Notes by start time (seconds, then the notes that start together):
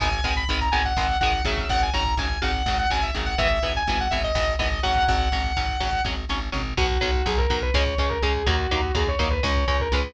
0.00 G#1 D#3 G#3 B3 G#5, kick, closed hi-hat
0.12 kick
0.24 G#1 D#3 G#3 B3, kick, closed hi-hat
0.36 B5, kick
0.48 G#1 D#3 G#3 B3 B5, kick, closed hi-hat
0.60 A#5, kick
0.71 G#1 D#3 G#3 B3 G#5, kick, closed hi-hat
0.85 F#5, kick
0.96 G#1 D#3 G#3 B3, kick, snare
1.09 kick
1.20 G#1 D#3 G#3 B3 F#5, kick, closed hi-hat
1.33 kick
1.45 G#1 C#3 F#3 E5, kick, closed hi-hat
1.57 kick
1.69 G#1 F#5, kick, closed hi-hat
1.81 G#5, kick
1.94 G#1 C#3 F#3 A#5, kick, closed hi-hat
2.06 kick
2.17 G#1 C#3 F#3 G#5, kick, closed hi-hat
2.30 kick
2.42 G#1 C#3 F#3 F#5, kick, closed hi-hat
2.54 kick
2.66 G#1 C#3 F#3 F#5, kick, snare
2.78 F#5, kick
2.90 G#1 C#3 F#3 G#5, kick, closed hi-hat
3.02 E5, kick
3.15 G#1 C#3 F#3, kick, closed hi-hat
3.26 F#5, kick
3.38 G#1 E3 B3 E5, kick, closed hi-hat
3.51 kick
3.62 G#1 E3 B3, kick, closed hi-hat
3.75 G#5, kick
3.87 G#1 E3 B3 G#5, kick, closed hi-hat
3.99 F#5, kick
4.10 G#1 E3 B3 E5, kick, closed hi-hat
4.23 D#5, kick
4.35 G#1 E3 B3, kick, snare
4.48 kick
4.59 G#1 E3 B3 D#5, kick, closed hi-hat
4.72 kick
4.83 G#1 F#3 C#4 F#5, kick, closed hi-hat
4.96 kick
5.08 G#1 F#5, kick, closed hi-hat
5.20 kick
5.32 G#1 F#3 C#4, kick, closed hi-hat
5.44 kick
5.56 G#1 F#3 C#4, kick, closed hi-hat
5.69 kick
5.80 G#1 F#3 C#4, kick, closed hi-hat
5.93 kick
6.05 G#1 F#3 C#4, kick, snare
6.29 G#1 F#3 C#4, snare
6.52 G#1 F#3 C#4, floor tom
6.77 B1 F#3 B3 F#4, kick, crash
6.90 kick
7.01 B1 F#3 B3, kick, ride
7.14 kick
7.26 B1 F#3 B3 G#4, kick, ride
7.38 A#4, kick
7.50 B1 F#3 B3, kick, ride
7.62 B4, kick
7.74 C#2 G#3 C#4 C#5, kick, snare
7.86 kick
7.98 C#2 G#3 C#4 C#5, kick, ride
8.09 A#4, kick
8.22 C#2 G#3 C#4 G#4, kick, ride
8.35 kick
8.46 D#2 F#3 A#3 D#4 F#4, kick, ride
8.59 kick
8.71 D#2 F#3 A#3 D#4, kick, ride
8.83 kick
8.95 D#2 F#3 A#3 D#4 G#4, kick, ride
9.07 C#5, kick
9.19 D#2 F#3 A#3 D#4, kick, ride
9.30 B4, kick
9.43 C#2 G#3 C#4 C#5, kick, snare
9.56 kick
9.68 C#2 G#3 C#4 C#5, kick, ride
9.80 A#4, kick
9.92 C#2 G#3 C#4 B4, kick, ride
10.04 kick